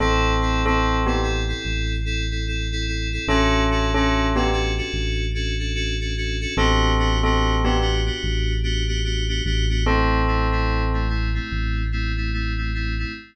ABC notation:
X:1
M:4/4
L:1/16
Q:"Swing 16ths" 1/4=73
K:Ador
V:1 name="Tubular Bells"
[CA]3 [CA]2 [B,G] z10 | [^CA]3 [CA]2 [B,G] z10 | [CA]3 [CA]2 [B,G] z10 | [CA]6 z10 |]
V:2 name="Electric Piano 2"
[CEA]2 [CEA] [CEA]2 [CEA] [CEA] [CEA]3 [CEA] [CEA] [CEA] [CEA] [CEA] [CEA] | [^CDFA]2 [CDFA] [CDFA]2 [CDFA] [CDFA] [CDFA]3 [CDFA] [CDFA] [CDFA] [CDFA] [CDFA] [CDFA] | [B,DFG]2 [B,DFG] [B,DFG]2 [B,DFG] [B,DFG] [B,DFG]3 [B,DFG] [B,DFG] [B,DFG] [B,DFG] [B,DFG] [B,DFG] | [A,CE]2 [A,CE] [A,CE]2 [A,CE] [A,CE] [A,CE]3 [A,CE] [A,CE] [A,CE] [A,CE] [A,CE] [A,CE] |]
V:3 name="Synth Bass 1" clef=bass
A,,,8 A,,,8 | A,,,8 A,,,8 | A,,,8 A,,,6 A,,,2- | A,,,8 A,,,8 |]